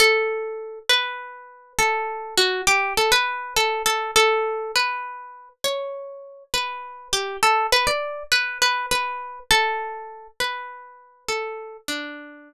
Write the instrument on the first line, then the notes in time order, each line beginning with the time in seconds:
acoustic guitar (steel)
0.00 A4
0.89 B4
1.79 A4
2.37 F#4
2.67 G4
2.97 A4
3.12 B4
3.56 A4
3.86 A4
4.16 A4
4.76 B4
5.64 C#5
6.54 B4
7.13 G4
7.43 A4
7.72 B4
7.87 D5
8.32 B4
8.62 B4
8.91 B4
9.51 A4
10.40 B4
11.28 A4
11.88 D4